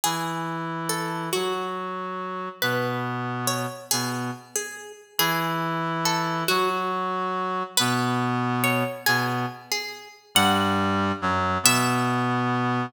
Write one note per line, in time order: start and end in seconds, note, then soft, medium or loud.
0.04 1.29 E3 medium
0.04 1.29 E4 medium
0.04 0.64 G#4 medium
0.89 1.31 A4 medium
1.33 2.49 F#3 medium
1.33 1.67 F#4 medium
1.33 2.49 F#4 medium
2.62 3.66 B2 medium
2.62 3.66 B3 medium
2.62 3.14 B4 medium
3.47 3.87 C#5 medium
3.91 4.31 B2 medium
3.91 4.31 B3 medium
3.91 4.09 G#4 medium
4.56 4.92 G#4 medium
5.18 6.44 E3 medium
5.18 6.44 E4 loud
5.18 5.80 G#4 loud
6.05 6.47 A4 medium
6.48 7.63 F#3 medium
6.48 6.70 F#4 medium
6.48 7.63 F#4 loud
7.77 8.83 B2 loud
7.77 8.83 B3 loud
7.77 8.29 B4 medium
8.64 9.03 C#5 medium
9.06 9.46 B2 medium
9.06 9.46 B3 loud
9.06 9.25 G#4 medium
9.72 10.08 G#4 medium
10.35 11.12 G2 loud
10.35 11.12 G3 loud
10.35 11.46 F#5 loud
11.22 11.58 F#2 loud
11.22 11.58 F#3 loud
11.63 12.86 B2 loud
11.63 12.86 B3 loud
11.63 12.62 E5 loud